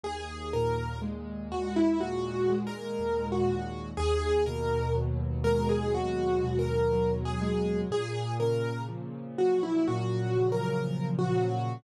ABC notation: X:1
M:4/4
L:1/16
Q:1/4=61
K:G#m
V:1 name="Acoustic Grand Piano"
G2 A2 z2 F E (3F4 A4 F4 | G2 A2 z2 A G (3F4 A4 G4 | G2 A2 z2 F E (3F4 A4 F4 |]
V:2 name="Acoustic Grand Piano" clef=bass
D,,2 A,,2 G,2 D,,2 A,,2 G,2 D,,2 A,,2 | D,,2 B,,2 F,2 G,2 D,,2 B,,2 F,2 G,2 | A,,2 C,2 ^E,2 F,2 A,,2 C,2 E,2 F,2 |]